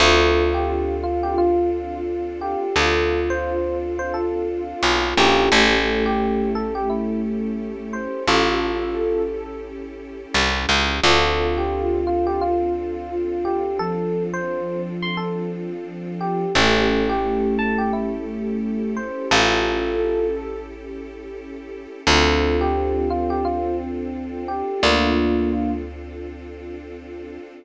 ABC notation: X:1
M:4/4
L:1/16
Q:"Swing 16ths" 1/4=87
K:Dm
V:1 name="Electric Piano 1"
A3 G3 F G F2 z4 G2 | A3 c3 z c A2 z4 G2 | A3 G3 A G E2 z4 c2 | [FA]6 z10 |
A3 G3 F G F2 z4 G2 | A3 c3 z c' A2 z4 G2 | A3 G3 a G E2 z4 c2 | [FA]6 z10 |
A3 G3 F G F2 z4 G2 | [B,D]6 z10 |]
V:2 name="Ocarina"
F16 | F16 | A,16 | A8 z8 |
F16 | F,16 | A,16 | A8 z8 |
C16 | F6 z10 |]
V:3 name="Electric Piano 1"
[CDFA]16- | [CDFA]14 [^CEGA]2- | [^CEGA]16- | [^CEGA]16 |
[CDFA]16- | [CDFA]16 | [^CEGA]16- | [^CEGA]16 |
[CDFA]16- | [CDFA]16 |]
V:4 name="Electric Bass (finger)" clef=bass
D,,16 | D,,12 =B,,,2 _B,,,2 | A,,,16 | A,,,12 C,,2 ^C,,2 |
D,,16- | D,,16 | A,,,16 | A,,,16 |
D,,16 | D,,16 |]
V:5 name="String Ensemble 1"
[CDFA]16- | [CDFA]16 | [^CEGA]16- | [^CEGA]16 |
[CDFA]16- | [CDFA]16 | [^CEGA]16- | [^CEGA]16 |
[CDFA]16- | [CDFA]16 |]